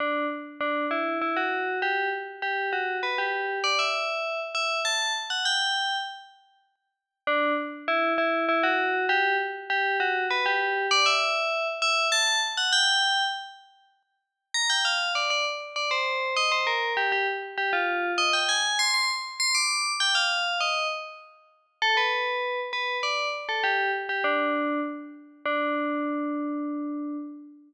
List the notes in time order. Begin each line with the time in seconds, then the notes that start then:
0.00 D4
0.61 D4
0.91 E4
1.21 E4
1.36 F#4
1.82 G4
2.42 G4
2.73 F#4
3.03 B4
3.18 G4
3.64 D5
3.79 E5
4.55 E5
4.85 A5
5.30 F#5
5.45 G5
7.27 D4
7.88 E4
8.18 E4
8.49 E4
8.63 F#4
9.09 G4
9.70 G4
10.00 F#4
10.31 B4
10.46 G4
10.91 D5
11.06 E5
11.82 E5
12.12 A5
12.57 F#5
12.72 G5
14.54 A#5
14.70 G5
14.85 F5
15.15 D5
15.30 D5
15.76 D5
15.91 C5
16.36 D#5
16.52 C5
16.67 A#4
16.97 G4
17.12 G4
17.58 G4
17.73 F4
18.18 D#5
18.33 G5
18.49 G#5
18.79 C6
18.94 C6
19.40 C6
19.55 D6
20.00 G5
20.15 F5
20.60 D#5
21.82 A4
21.97 B4
22.73 B4
23.03 D5
23.49 A4
23.64 G4
24.09 G4
24.24 D4
25.45 D4